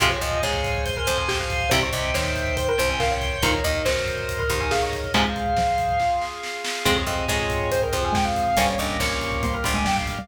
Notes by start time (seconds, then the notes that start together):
0.00 F2 C3 F3 G#3 C5 F5 G#5, kick, closed hi-hat
0.11 C#5, kick
0.21 F2 F3 D#5, kick, closed hi-hat
0.32 kick
0.43 G#2 G#3 C#5, kick, snare
0.53 kick
0.64 kick, closed hi-hat
0.75 kick
0.85 C5 G#5 C6, kick, closed hi-hat
0.97 A#4, kick
1.07 F2 F3 C5, kick, closed hi-hat
1.18 G#5, kick
1.28 G4 G5, kick, snare
1.40 F5, kick
1.50 kick, closed hi-hat
1.61 kick
1.70 C2 C3 E3 G3 C5 E5 G5, kick, closed hi-hat
1.81 C#5, kick
1.92 C2 C3 D#5, kick, closed hi-hat
2.04 kick
2.14 D#2 D#3 C5 C#5, kick, snare
2.25 kick
2.36 kick, closed hi-hat
2.47 kick
2.57 C5 G5 C6, kick, closed hi-hat
2.68 A#4, kick
2.78 C2 C3 C5, kick, closed hi-hat
2.89 G#5, kick
2.99 A#4 F5, kick, snare
3.11 C#5, kick
3.21 kick, closed hi-hat
3.32 kick
3.42 D#2 A#2 D#3 A#4 C5 D#5, kick, closed hi-hat
3.53 C#5, kick
3.64 D#2 D#3 D#5, kick, closed hi-hat
3.75 kick
3.85 F#2 F#3 C5, kick, snare
3.97 kick
4.07 kick, closed hi-hat
4.18 kick
4.29 C5, kick, closed hi-hat
4.39 A#4, kick
4.49 D#2 D#3 C5, kick, closed hi-hat
4.61 G#5, kick
4.71 G#4 F5, kick, snare
4.82 C#5, kick
4.92 kick, closed hi-hat
5.04 kick
5.14 G#2 C3 F3 G#3 G#4 C5 F5, kick, closed hi-hat
5.25 kick
5.36 kick, closed hi-hat
5.46 kick
5.57 F3, kick, snare
5.68 kick
5.78 kick, closed hi-hat
5.89 kick
6.00 F4 G#4 F5, kick, snare
6.22 snare
6.43 snare
6.64 snare
6.85 F2 G#3 C4 F4 G#4 C5, kick, crash
6.96 C#5, kick
7.07 F2 F3 D#5, kick, closed hi-hat
7.18 kick
7.28 G#2 G#3 C#5, kick, snare
7.39 kick
7.50 kick, closed hi-hat
7.60 kick
7.71 C4 G#4 C5, kick, closed hi-hat
7.82 A#4, kick
7.93 F2 F3 C5, kick, closed hi-hat
8.03 G#5, kick
8.13 G#3 G5, kick, snare
8.25 F5, kick
8.36 kick, closed hi-hat
8.47 kick
8.57 G1 G3 A#3 C#4 G4 C5, kick, closed hi-hat
8.68 C#5, kick
8.78 G1 G2 D#5, kick, closed hi-hat
8.89 kick
9.00 A#1 A#2 C#5, kick, snare
9.11 kick
9.21 kick, closed hi-hat
9.32 kick
9.43 G3 A#3 G4 C5, kick, closed hi-hat
9.54 A#4, kick
9.64 G1 G2 C5, kick, closed hi-hat
9.74 G#3 G#5, kick
9.85 G3 G5, kick, snare
9.96 F5, kick
10.07 kick, closed hi-hat
10.17 G3, kick